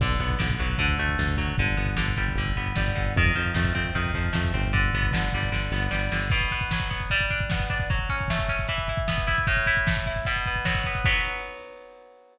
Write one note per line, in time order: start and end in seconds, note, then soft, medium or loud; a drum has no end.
0.00 0.16 B1 loud
0.00 0.38 D3 loud
0.00 kick loud
0.00 crash loud
0.10 kick medium
0.19 0.37 B1 loud
0.19 0.76 B3 medium
0.19 kick medium
0.19 closed hi-hat medium
0.30 kick medium
0.39 0.57 B1 loud
0.39 0.76 D3 medium
0.39 kick medium
0.39 snare loud
0.50 kick medium
0.59 0.76 B1 medium
0.59 0.78 F#3 medium
0.59 kick medium
0.59 closed hi-hat medium
0.70 kick medium
0.78 0.96 D2 loud
0.78 1.18 D3 loud
0.78 kick medium
0.78 closed hi-hat loud
0.88 kick medium
0.98 1.16 D2 loud
0.98 1.55 A3 medium
0.98 kick medium
0.98 closed hi-hat medium
1.09 kick medium
1.18 1.35 D2 loud
1.18 1.56 D3 medium
1.18 kick medium
1.18 snare medium
1.28 kick medium
1.37 1.54 D2 medium
1.37 1.56 F#3 medium
1.37 kick medium
1.37 closed hi-hat medium
1.48 kick medium
1.58 1.75 G1 loud
1.58 1.96 D3 medium
1.58 kick loud
1.58 closed hi-hat medium
1.67 kick medium
1.77 1.95 G1 loud
1.77 2.56 B3 medium
1.77 kick medium
1.77 closed hi-hat medium
1.86 kick medium
1.96 2.14 G1 medium
1.96 2.38 D3 medium
1.96 kick medium
1.96 snare loud
2.08 kick medium
2.16 2.34 G1 medium
2.16 2.76 G3 medium
2.16 kick medium
2.16 closed hi-hat medium
2.28 kick medium
2.35 2.52 G1 loud
2.35 2.95 D3 medium
2.35 kick medium
2.35 closed hi-hat medium
2.46 kick medium
2.56 2.73 G1 medium
2.56 3.13 B3 medium
2.56 kick medium
2.56 closed hi-hat medium
2.66 kick medium
2.75 2.93 G1 medium
2.75 3.14 G3 medium
2.75 kick medium
2.75 snare loud
2.88 kick medium
2.95 3.14 G1 medium
2.95 3.14 D3 medium
2.95 kick medium
2.95 closed hi-hat medium
3.06 kick medium
3.15 3.32 F2 loud
3.15 3.95 D#3 loud
3.15 kick loud
3.15 closed hi-hat loud
3.25 kick medium
3.35 3.53 F2 medium
3.35 4.14 F3 medium
3.35 kick medium
3.35 closed hi-hat medium
3.45 kick medium
3.54 3.72 F2 loud
3.54 4.32 A3 medium
3.54 kick medium
3.54 snare loud
3.65 kick medium
3.75 3.92 F2 medium
3.75 4.53 C4 medium
3.75 kick medium
3.75 closed hi-hat medium
3.85 kick medium
3.95 4.12 F2 medium
3.95 4.70 D#3 medium
3.95 kick medium
3.95 closed hi-hat medium
4.06 kick medium
4.14 4.31 F2 medium
4.14 4.71 F3 medium
4.14 kick medium
4.14 closed hi-hat medium
4.25 kick medium
4.33 4.52 F2 loud
4.33 4.70 A3 medium
4.33 kick medium
4.33 snare loud
4.44 kick medium
4.54 4.91 G1 loud
4.54 4.72 C4 medium
4.54 kick medium
4.54 closed hi-hat medium
4.65 kick medium
4.73 5.12 D3 medium
4.73 kick medium
4.73 closed hi-hat medium
4.84 kick medium
4.93 5.11 G1 medium
4.93 5.72 B3 medium
4.93 kick medium
4.93 closed hi-hat medium
5.03 kick medium
5.12 5.29 G1 medium
5.12 5.51 D3 medium
5.12 kick medium
5.12 snare loud
5.23 kick medium
5.32 5.50 G1 medium
5.32 5.90 G3 medium
5.32 kick medium
5.32 closed hi-hat medium
5.43 kick medium
5.52 5.69 G1 medium
5.52 6.11 D3 medium
5.52 kick medium
5.52 snare medium
5.71 5.88 G1 loud
5.71 6.29 B3 medium
5.71 snare medium
5.91 6.09 G1 medium
5.91 6.28 G3 medium
5.91 snare medium
6.12 6.29 G1 medium
6.12 6.31 D3 medium
6.12 snare loud
6.30 7.06 B2 loud
6.30 kick loud
6.30 crash loud
6.41 kick medium
6.41 closed hi-hat medium
6.51 6.90 B3 medium
6.51 kick medium
6.51 closed hi-hat medium
6.61 kick medium
6.61 closed hi-hat medium
6.71 7.10 F#3 medium
6.71 kick medium
6.71 snare loud
6.80 kick medium
6.80 closed hi-hat medium
6.90 7.09 B3 medium
6.90 kick medium
6.90 closed hi-hat medium
7.00 kick medium
7.00 closed hi-hat medium
7.10 7.86 G3 loud
7.10 kick medium
7.10 closed hi-hat medium
7.19 kick medium
7.19 closed hi-hat medium
7.30 7.69 D4 medium
7.30 kick medium
7.30 closed hi-hat medium
7.40 kick medium
7.40 closed hi-hat medium
7.50 7.89 B3 medium
7.50 kick medium
7.50 snare loud
7.60 kick medium
7.60 closed hi-hat medium
7.69 7.89 D4 medium
7.69 kick medium
7.69 closed hi-hat medium
7.79 kick medium
7.79 open hi-hat medium
7.90 8.65 F#3 medium
7.90 kick loud
7.90 closed hi-hat loud
7.99 kick medium
7.99 closed hi-hat medium
8.09 8.49 C#4 medium
8.09 kick medium
8.09 closed hi-hat medium
8.19 kick medium
8.19 closed hi-hat medium
8.28 8.68 A3 medium
8.28 kick medium
8.28 snare loud
8.39 kick medium
8.39 closed hi-hat medium
8.49 8.68 C#4 medium
8.49 kick medium
8.49 closed hi-hat medium
8.58 kick medium
8.58 closed hi-hat medium
8.68 9.44 E3 loud
8.68 kick medium
8.68 closed hi-hat loud
8.78 kick medium
8.78 closed hi-hat medium
8.88 9.27 E4 medium
8.88 kick medium
8.88 closed hi-hat medium
8.97 kick medium
8.97 closed hi-hat medium
9.08 9.45 B3 medium
9.08 kick medium
9.08 snare loud
9.17 kick medium
9.17 closed hi-hat medium
9.27 9.46 E4 medium
9.27 kick medium
9.27 closed hi-hat medium
9.37 kick medium
9.37 closed hi-hat medium
9.47 10.22 A2 loud
9.47 kick loud
9.47 closed hi-hat loud
9.57 kick medium
9.57 closed hi-hat medium
9.66 10.06 E4 medium
9.66 kick medium
9.66 closed hi-hat medium
9.76 kick medium
9.76 closed hi-hat medium
9.87 10.25 A3 medium
9.87 kick medium
9.87 snare loud
9.96 kick medium
9.96 closed hi-hat medium
10.06 10.26 E4 medium
10.06 kick medium
10.06 closed hi-hat medium
10.16 kick medium
10.16 closed hi-hat medium
10.25 11.01 B2 loud
10.25 kick medium
10.25 closed hi-hat loud
10.36 kick medium
10.36 closed hi-hat medium
10.45 10.86 B3 medium
10.45 kick medium
10.45 closed hi-hat medium
10.56 kick medium
10.56 closed hi-hat medium
10.65 11.03 F#3 medium
10.65 kick medium
10.65 snare loud
10.75 kick medium
10.75 closed hi-hat medium
10.84 11.05 B3 medium
10.84 kick medium
10.84 closed hi-hat medium
10.95 kick medium
10.95 closed hi-hat medium
11.05 12.38 F#3 loud
11.05 12.38 B3 loud
11.05 kick loud
11.05 crash loud